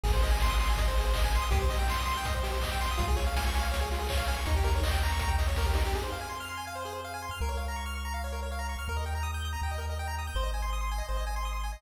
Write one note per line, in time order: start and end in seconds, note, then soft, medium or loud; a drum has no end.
0.04 1.39 G#1 loud
0.04 0.12 G#4 loud
0.04 kick loud
0.04 crash medium
0.13 0.21 C5 medium
0.22 0.31 D#5 medium
0.22 open hi-hat medium
0.31 0.39 G#5 medium
0.40 0.50 C6 medium
0.40 kick medium
0.40 snare medium
0.50 0.58 D#6 medium
0.59 0.68 C6 medium
0.59 open hi-hat medium
0.70 0.78 G#5 medium
0.77 0.87 D#5 medium
0.77 kick medium
0.77 closed hi-hat medium
0.88 0.96 C5 medium
0.97 1.06 G#4 medium
0.97 open hi-hat medium
1.05 1.13 C5 medium
1.13 1.23 D#5 medium
1.13 kick medium
1.13 clap loud
1.24 1.33 G#5 medium
1.32 1.43 C6 medium
1.32 open hi-hat medium
1.42 1.50 D#6 medium
1.51 2.87 C2 medium
1.51 1.59 G4 loud
1.51 kick loud
1.51 closed hi-hat medium
1.62 1.70 C5 medium
1.70 1.78 D#5 medium
1.70 open hi-hat medium
1.79 1.87 G5 medium
1.88 1.98 C6 medium
1.88 kick medium
1.88 clap medium
1.99 2.08 D#6 medium
2.06 2.14 C6 loud
2.06 open hi-hat medium
2.17 2.25 G5 medium
2.25 2.34 D#5 medium
2.25 kick medium
2.25 closed hi-hat loud
2.34 2.43 C5 medium
2.43 2.52 G4 medium
2.43 open hi-hat medium
2.52 2.60 C5 medium
2.61 2.71 D#5 medium
2.61 kick medium
2.61 clap loud
2.72 2.80 G5 medium
2.81 2.89 C6 medium
2.81 open hi-hat medium
2.91 2.99 D#6 medium
2.98 4.35 C#2 loud
2.98 3.06 F4 loud
2.98 kick loud
2.98 closed hi-hat medium
3.08 3.16 G#4 medium
3.16 3.25 C#5 medium
3.16 open hi-hat medium
3.27 3.35 F5 medium
3.36 3.45 G#5 medium
3.36 kick medium
3.36 snare loud
3.46 3.55 C#6 medium
3.54 3.63 G#5 medium
3.54 open hi-hat medium
3.61 3.70 F5 medium
3.71 3.80 C#5 medium
3.71 kick medium
3.71 closed hi-hat loud
3.81 3.89 G#4 medium
3.91 4.00 F4 medium
3.91 open hi-hat medium
3.99 4.08 G#4 medium
4.09 4.18 C#5 loud
4.09 kick medium
4.09 clap loud
4.17 4.25 F5 medium
4.26 4.36 G#5 medium
4.26 open hi-hat medium
4.36 4.45 C#6 medium
4.46 5.82 D#2 loud
4.46 4.55 D#4 loud
4.46 kick medium
4.46 closed hi-hat medium
4.56 4.65 G4 medium
4.63 4.73 A#4 medium
4.63 open hi-hat medium
4.75 4.84 C#5 medium
4.81 4.91 D#5 medium
4.81 kick medium
4.81 clap loud
4.91 4.99 G5 medium
5.03 5.11 A#5 medium
5.03 open hi-hat medium
5.12 5.20 C#6 medium
5.19 5.30 A#5 medium
5.19 kick medium
5.19 closed hi-hat loud
5.28 5.36 G5 medium
5.38 5.47 D#5 medium
5.38 open hi-hat medium
5.48 5.56 C#5 medium
5.56 5.66 A#4 medium
5.56 kick medium
5.56 snare medium
5.66 5.74 G4 medium
5.74 5.83 D#4 medium
5.74 open hi-hat medium
5.85 5.93 G4 medium
5.94 7.29 F2 medium
5.94 6.03 G#4 medium
6.03 6.11 C5 medium
6.12 6.20 F5 medium
6.21 6.29 G#5 medium
6.29 6.38 C6 medium
6.40 6.49 F6 medium
6.49 6.57 C6 medium
6.57 6.66 G#5 medium
6.67 6.75 F5 medium
6.75 6.84 C5 medium
6.85 6.93 G#4 medium
6.93 7.01 C5 medium
7.04 7.13 F5 medium
7.14 7.22 G#5 medium
7.22 7.31 C6 medium
7.31 7.39 F6 medium
7.40 8.76 C#2 medium
7.40 7.50 A#4 medium
7.49 7.57 C#5 medium
7.57 7.66 F5 medium
7.68 7.76 A#5 medium
7.76 7.84 C#6 medium
7.86 7.94 F6 medium
7.95 8.04 C#6 medium
8.05 8.13 A#5 medium
8.14 8.22 F5 medium
8.24 8.32 C#5 medium
8.32 8.41 A#4 medium
8.43 8.51 C#5 medium
8.52 8.60 F5 medium
8.59 8.67 A#5 medium
8.69 8.77 C#6 medium
8.79 8.87 F6 medium
8.88 9.56 D#2 medium
8.88 8.97 A#4 medium
8.97 9.05 D#5 medium
9.06 9.14 G5 medium
9.15 9.23 A#5 medium
9.23 9.31 D#6 medium
9.34 9.42 G6 medium
9.45 9.53 D#6 medium
9.53 9.61 A#5 medium
9.62 10.29 D#2 medium
9.62 9.71 G5 medium
9.71 9.80 D#5 medium
9.78 9.86 A#4 medium
9.89 9.98 D#5 medium
9.99 10.07 G5 medium
10.08 10.16 A#5 medium
10.18 10.27 D#6 medium
10.27 10.36 G6 medium
10.35 11.02 G#1 medium
10.35 10.44 C5 medium
10.43 10.51 D#5 medium
10.54 10.62 G#5 medium
10.62 10.71 C6 medium
10.73 10.81 D#6 medium
10.81 10.89 C6 medium
10.91 11.00 G#5 medium
10.98 11.06 D#5 medium
11.09 11.77 G#1 medium
11.09 11.17 C5 medium
11.17 11.25 D#5 medium
11.27 11.35 G#5 medium
11.36 11.44 C6 medium
11.45 11.53 D#6 medium
11.53 11.61 C6 medium
11.63 11.72 G#5 medium
11.73 11.81 D#5 medium